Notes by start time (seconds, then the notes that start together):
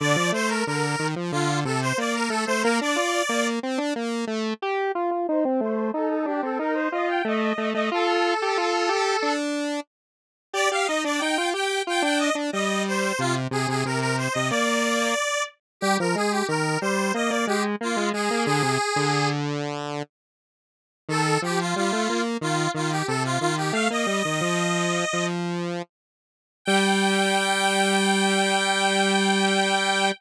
0.00 D3 D5
0.16 F3
0.32 A3 C5
0.48 A#4
0.66 D3 A#4
0.99 D#3
1.16 F3
1.32 D3 F4
1.65 C3 A4
1.82 C5
1.98 A#3 D5
2.14 A#4
2.29 A3 A4
2.46 A3 C5
2.62 A#3 A#4
2.81 D4 D5
2.96 F4
3.29 A#3
3.63 C4
3.78 D4
3.96 A#3
4.27 A3
4.62 G4
4.95 F4
5.11 F4
5.28 D#4 C5
5.45 C4
5.61 A3 C5
5.93 D#4 A4
6.09 A4
6.26 D4 G4
6.42 C4 A4
6.59 D#4 A#4
6.74 C5
6.92 F4 D#5
7.08 G5
7.25 A3 D#5
7.58 A3
7.73 A3 D#5
7.91 F4 A4
8.42 G4
8.57 F4
8.89 G4
9.22 D4
10.53 G4 D5
10.71 G4 F5
10.86 D#4 D#5
11.04 D4 D5
11.19 D#4 G5
11.38 F4
11.53 G4 G5
11.87 F4 G5
12.02 D4 G5
12.19 D#5
12.35 D4
12.52 G3 D#5
12.88 C5
13.19 C3 F4
13.51 C3 G#4
13.68 C3 G#4
13.85 C3 A#4
14.00 A#4
14.18 C5
14.33 C3 D#5
14.49 A#3 D5
15.81 G3 G4
16.00 F3 A#4
16.15 G#3 G#4
16.31 G4
16.48 D#3 A#4
16.81 G3 C5
17.14 A#3 D#5
17.29 A#3 D5
17.47 G#3 G4
17.81 A#3 F4
17.97 G#3
18.13 G#3 G#4
18.30 A#3
18.45 D3 G#4
18.62 C3
18.96 D3
21.09 D#3 A4
21.42 F3 G4
21.60 F4
21.76 G3 F4
21.92 A3
22.09 A#3
22.41 D#3 F4
22.74 D#3 F4
22.91 G4
23.07 C3 A4
23.25 F4
23.40 D#3 F4
23.57 G4
23.72 A3 F5
23.90 A#3 D#5
24.07 G3
24.25 D#3
24.41 F3
25.13 F3
26.65 G3 G5